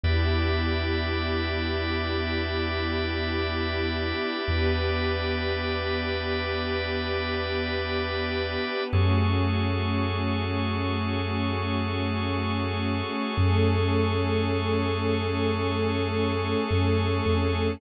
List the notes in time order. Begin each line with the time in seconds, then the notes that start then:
0.03 E2 B3 D4 E4 G4 B4 D5 E5
4.48 E2 B3 D4 G4 B4
8.93 F#2 A3 C#4 F#4 G#4 A4 C#5
13.37 F#2 A3 C#4 G#4 A4
16.71 F#2
17.26 F2